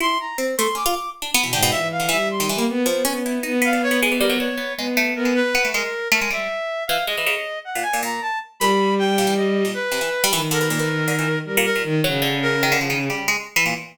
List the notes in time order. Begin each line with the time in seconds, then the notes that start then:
0.00 E4 C6
0.20 A#5
0.38 C4
0.58 A3 C6
0.75 C#4 D6
0.86 F4
1.22 D4
1.34 B3
1.43 B2 E3
1.53 G#2 D3 G5
1.63 B2
1.71 A#2 E3 E5
1.92 F5
2.00 D3
2.09 E3 G3 E5
2.31 C6
2.40 D#3
2.49 E3
2.56 G3 A#3
2.69 B3
2.86 F3 B3
3.04 B3 C#4
3.26 E4
3.43 B3 D#4
3.62 B3 F5
3.73 D4
3.83 C#5
3.91 B3
4.03 G#3
4.12 E3
4.20 G3 A#4
4.30 F#3
4.39 D4 C#5
4.57 B3
4.77 G#3 B3
4.97 A3
5.16 B3 A#4
5.25 G#3
5.35 B4
5.55 B3
5.65 A3
5.74 G#3 A#4
6.12 A3 A#4
6.21 G#3
6.30 G3 E5
6.87 E3 F5
7.07 G#3 D#5
7.17 E3
7.26 C#3
7.65 F#5
7.75 A#2
7.82 G#5
7.93 A#2
8.03 A#2 A#5
8.22 A5
8.60 A#2 G3 B5
8.99 G5
9.18 A#2
9.27 E3
9.37 D#5
9.65 A#2
9.74 B4
9.92 C3
10.01 E3
10.24 G3
10.32 D#3 E3
10.51 D3 A#4
10.61 B2
10.70 A#2
10.79 E3
11.08 D3
11.19 E3
11.45 G3 A#4
11.57 A#2
11.65 A#4
11.75 A#2
11.83 D#3
12.04 C#3 F#3
12.22 D3
12.42 A#4
12.63 D#3
12.72 D3
12.81 F3
12.90 D#3
13.10 G3
13.28 G#3
13.56 E3
13.66 A#2